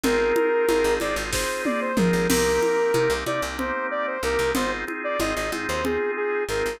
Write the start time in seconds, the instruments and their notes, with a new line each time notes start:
0.03 electric bass (finger) G#1, drawbar organ C4 D#4 F4 G#4, lead 2 (sawtooth) A#4, low conga
0.36 drawbar organ C4 D#4 F4 G#4, high conga
0.69 electric bass (finger) G#1, drawbar organ C4 D#4 F4 G#4, high conga
0.84 electric bass (finger) G#1
1.00 electric bass (finger) G#1, drawbar organ C4 D#4 F4 G#4, lead 2 (sawtooth) D5, high conga
1.16 electric bass (finger) G#1
1.32 drawbar organ C4 D#4 F4 G#4, lead 2 (sawtooth) C5, kick, snare
1.65 lead 2 (sawtooth) D5, high tom
1.81 lead 2 (sawtooth) C5
1.97 electric bass (finger) G#1, drawbar organ C4 D#4 F4 G#4, lead 2 (sawtooth) A#4, mid tom
2.13 electric bass (finger) G#1
2.30 electric bass (finger) C2, drawbar organ A#3 C4 D#4 G4, lead 2 (sawtooth) A#4, crash, low conga
2.62 drawbar organ A#3 C4 D#4 G4, high conga
2.94 electric bass (finger) C3, drawbar organ A#3 C4 D#4 G4, high conga
3.10 electric bass (finger) C2
3.26 electric bass (finger) C3, drawbar organ A#3 C4 D#4 G4, lead 2 (sawtooth) D5, high conga
3.42 electric bass (finger) C2
3.58 drawbar organ A#3 C4 D#4 G4, lead 2 (sawtooth) C5, low conga
3.91 lead 2 (sawtooth) D5
4.07 lead 2 (sawtooth) C5
4.23 electric bass (finger) C2, drawbar organ A#3 C4 D#4 G4, lead 2 (sawtooth) A#4
4.39 electric bass (finger) C2
4.55 electric bass (finger) G#1, drawbar organ C4 D#4 F4 G#4, lead 2 (sawtooth) C5, low conga
4.87 drawbar organ C4 D#4 F4 G#4, high conga
5.04 lead 2 (sawtooth) D5
5.19 electric bass (finger) G#1, drawbar organ C4 D#4 F4 G#4, lead 2 (sawtooth) D#5, high conga
5.36 electric bass (finger) G#1, lead 2 (sawtooth) D#5
5.52 electric bass (finger) G#2, drawbar organ C4 D#4 F4 G#4, high conga
5.68 electric bass (finger) D#2, lead 2 (sawtooth) C5
5.85 drawbar organ C4 D#4 F4 G#4, lead 2 (sawtooth) G#4, low conga
6.17 lead 2 (sawtooth) G#4
6.49 electric bass (finger) G#1, drawbar organ C4 D#4 F4 G#4, lead 2 (sawtooth) A#4
6.66 electric bass (finger) G#1